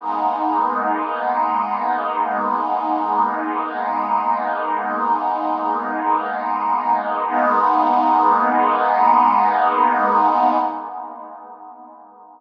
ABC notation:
X:1
M:4/4
L:1/8
Q:1/4=66
K:G#phr
V:1 name="Pad 2 (warm)"
[G,^A,B,D]8 | [G,^A,B,D]8 | [G,^A,B,D]8 |]